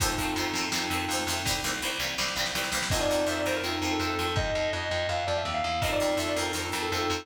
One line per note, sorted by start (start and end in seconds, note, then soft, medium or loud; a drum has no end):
0.00 0.15 F2 medium
0.00 0.08 D#3 medium
0.00 0.08 F3 loud
0.00 0.08 A3 loud
0.00 0.65 C4 loud
0.00 0.08 C4 loud
0.00 0.65 D#4 medium
0.00 0.65 F4 medium
0.00 0.65 A4 loud
0.00 kick medium
0.00 crash medium
0.18 0.34 F2 medium
0.18 0.26 D#3 medium
0.18 0.26 F3 medium
0.18 0.26 A3 medium
0.18 0.26 C4 medium
0.18 kick medium
0.18 closed hi-hat medium
0.36 0.51 F2 medium
0.36 0.45 D#3 medium
0.36 0.45 F3 medium
0.36 0.45 A3 medium
0.36 0.45 C4 medium
0.36 closed hi-hat medium
0.53 0.69 F2 medium
0.53 0.62 D#3 medium
0.53 0.62 F3 medium
0.53 0.62 A3 medium
0.53 closed hi-hat medium
0.58 0.62 C4 medium
0.72 0.89 F2 medium
0.72 0.80 D#3 medium
0.72 0.80 F3 medium
0.72 0.80 A3 medium
0.72 1.39 C4 medium
0.72 0.80 C4 loud
0.72 1.39 D#4 medium
0.72 1.39 F4 medium
0.72 1.39 A4 medium
0.72 snare medium
0.90 1.06 F2 medium
0.90 0.98 D#3 medium
0.90 0.98 F3 medium
0.90 0.98 A3 medium
0.90 0.98 C4 medium
0.90 closed hi-hat medium
1.09 1.24 F2 medium
1.09 1.18 D#3 medium
1.09 1.18 F3 medium
1.09 1.18 A3 medium
1.09 closed hi-hat medium
1.13 1.18 C4 medium
1.27 1.42 F2 medium
1.27 1.35 D#3 medium
1.27 1.35 F3 medium
1.27 1.35 A3 medium
1.27 1.35 C4 medium
1.27 open hi-hat medium
1.45 1.61 C2 medium
1.45 1.54 E3 medium
1.45 1.54 G3 loud
1.45 1.54 A#3 loud
1.45 1.54 C4 loud
1.45 kick medium
1.45 snare medium
1.62 1.80 C2 medium
1.62 1.71 E3 medium
1.62 1.71 G3 medium
1.62 1.71 A#3 medium
1.62 snare medium
1.66 1.71 C4 medium
1.82 1.98 C2 medium
1.82 1.90 E3 medium
1.82 1.90 G3 medium
1.82 1.90 A#3 medium
1.82 1.90 C4 medium
1.82 snare soft
1.99 2.15 C2 medium
1.99 2.07 E3 medium
1.99 2.07 G3 medium
1.99 2.07 A#3 medium
1.99 2.07 C4 medium
1.99 snare medium
2.18 2.34 C2 medium
2.18 2.25 E3 medium
2.18 2.25 G3 medium
2.18 2.25 A#3 medium
2.18 2.25 C4 medium
2.18 snare medium
2.28 snare medium
2.36 2.52 C2 medium
2.36 2.44 E3 medium
2.36 2.44 G3 medium
2.36 2.44 A#3 medium
2.36 2.44 C4 medium
2.36 snare medium
2.46 snare medium
2.55 2.70 C2 medium
2.55 2.62 E3 medium
2.55 2.62 G3 medium
2.55 2.62 A#3 medium
2.55 2.62 C4 medium
2.55 snare medium
2.64 snare medium
2.72 2.88 C2 medium
2.72 2.80 E3 medium
2.72 2.80 G3 medium
2.72 2.80 A#3 medium
2.72 2.80 C4 medium
2.72 snare medium
2.83 snare medium
2.90 3.07 F2 loud
2.90 2.99 D#3 medium
2.90 2.99 F3 medium
2.90 2.99 A3 medium
2.90 3.57 C4 medium
2.90 3.57 D#4 loud
2.90 3.57 F4 loud
2.90 3.57 A4 medium
2.90 3.00 D#5 medium
2.90 kick medium
2.90 crash loud
2.95 2.99 C4 medium
3.00 3.25 D5 loud
3.10 3.25 F2 medium
3.10 3.18 D#3 medium
3.10 3.18 F3 medium
3.10 3.18 A3 medium
3.10 3.18 C4 medium
3.27 3.42 F2 medium
3.27 3.34 D#3 medium
3.27 3.34 F3 medium
3.27 3.34 A3 medium
3.27 3.34 C4 medium
3.27 3.36 E5 medium
3.37 3.45 D5 medium
3.46 3.62 F2 medium
3.46 3.53 D#3 medium
3.46 3.53 F3 medium
3.46 3.53 A3 medium
3.46 3.53 C4 medium
3.46 3.55 C5 medium
3.55 3.71 A#4 medium
3.63 3.79 F2 medium
3.63 3.71 D#3 medium
3.63 3.71 F3 medium
3.63 3.71 A3 medium
3.63 4.29 C4 medium
3.63 3.71 C4 medium
3.63 4.29 D#4 medium
3.63 4.29 F4 medium
3.63 4.29 A4 medium
3.82 3.97 F2 medium
3.82 3.90 D#3 medium
3.82 3.90 F3 medium
3.82 3.90 A3 medium
3.82 3.90 C4 medium
3.91 3.99 A4 medium
4.00 4.15 F2 medium
4.00 4.08 D#3 medium
4.00 4.08 F3 medium
4.00 4.08 A3 medium
4.00 4.08 C4 medium
4.00 4.31 A4 medium
4.19 4.34 F2 medium
4.19 4.26 D#3 medium
4.19 4.26 F3 medium
4.19 4.26 A3 medium
4.19 4.26 C4 medium
4.36 4.51 F2 loud
4.36 4.72 D#5 medium
4.36 kick loud
4.55 4.71 F2 medium
4.73 4.88 F2 medium
4.73 5.07 D#5 medium
4.91 5.07 F2 medium
5.09 5.24 F2 medium
5.09 5.26 F5 medium
5.27 5.43 F2 medium
5.27 5.36 D5 medium
5.37 5.52 E5 medium
5.45 5.62 D#2 medium
5.54 5.78 F5 medium
5.64 5.81 E2 medium
5.82 5.97 F2 loud
5.82 5.90 D#3 medium
5.82 5.90 F3 medium
5.82 5.90 A3 medium
5.82 6.14 C4 loud
5.82 5.90 C4 medium
5.82 6.14 D#4 loud
5.82 6.14 F4 loud
5.82 6.14 A4 medium
5.82 5.91 D#5 medium
5.82 kick medium
5.91 6.13 D5 medium
6.00 6.16 F2 medium
6.00 6.07 D#3 medium
6.00 6.07 F3 medium
6.00 6.07 A3 medium
6.00 6.07 C4 medium
6.17 6.32 F2 medium
6.17 6.25 D#3 medium
6.17 6.25 F3 medium
6.17 6.25 A3 medium
6.17 6.51 C4 medium
6.17 6.25 C4 medium
6.17 6.51 D#4 medium
6.17 6.51 F4 medium
6.17 6.51 A4 loud
6.17 6.27 E5 medium
6.28 6.36 D5 medium
6.36 6.52 F2 medium
6.36 6.44 D#3 medium
6.36 6.44 F3 medium
6.36 6.44 A3 medium
6.36 6.44 C4 medium
6.36 6.46 A#4 medium
6.46 6.62 A#4 medium
6.53 6.70 F2 medium
6.53 6.60 D#3 medium
6.53 6.60 F3 medium
6.53 6.60 A3 medium
6.53 6.88 C4 medium
6.53 6.60 C4 medium
6.53 6.88 D#4 medium
6.53 6.88 F4 medium
6.53 6.88 A4 medium
6.72 6.89 F2 medium
6.72 6.79 D#3 medium
6.72 6.79 F3 medium
6.72 6.79 A3 medium
6.72 6.79 C4 medium
6.82 6.91 A4 medium
6.91 7.07 F2 medium
6.91 7.00 D#3 medium
6.91 7.00 F3 medium
6.91 7.00 A3 medium
6.91 7.24 C4 medium
6.91 7.00 C4 medium
6.91 7.24 D#4 medium
6.91 7.24 F4 loud
6.91 7.22 A4 medium
6.91 7.24 A4 medium
7.10 7.25 F2 loud
7.10 7.18 D#3 medium
7.10 7.18 F3 medium
7.10 7.18 A3 medium
7.10 7.18 C4 medium